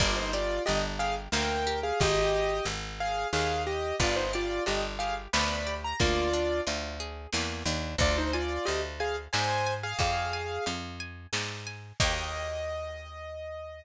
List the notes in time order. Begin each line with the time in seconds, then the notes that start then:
0.00 G1 A#3 F4 D5, kick, crash
0.17 D#4 C5
0.33 F4 G4 D5
0.66 G1 D4 G4 D#5, closed hi-hat
0.99 G4 G#4 F5
1.32 D2 A#3 A#4 G5, snare
1.67 G4
1.83 G#4 F5
2.00 G#1 G4 D#5, kick, closed hi-hat
2.65 G#1, closed hi-hat
3.00 G#4 F5
3.33 D#2 G#4 F5, snare
3.67 G4 D#5
4.00 G1 B3 F4 D5, kick, closed hi-hat
4.16 D#4 C5
4.33 F4 G4 D5
4.66 G1 D4 G4 D#5, closed hi-hat
4.99 G4 G#4 F5
5.33 D2 B3 D5 B5, snare
5.67 G4
5.84 A#5
6.00 D2 A#3 F4 D5, kick, closed hi-hat
6.33 D4
6.67 D2 F4, closed hi-hat
7.00 G#4
7.33 E2 A#3, snare
7.66 D#2 D4
7.98 D2 F4 D5, kick, closed hi-hat
8.18 D#4 C5
8.33 F4 D5 G#5
8.65 D2 G4 D#5 F5, closed hi-hat
9.00 G#4 F5 G#5
9.33 G#2 C5 D5 G#5, snare
9.67 G#5
9.83 G#4 F5
9.99 F2 G#4 D5 F5, kick, closed hi-hat
10.33 G#5
10.66 F2 F5, closed hi-hat
11.00 G#5
11.33 G#2 D5, snare
11.67 G#5
12.00 D#2 A#3 D#4 G4 D#5, kick, crash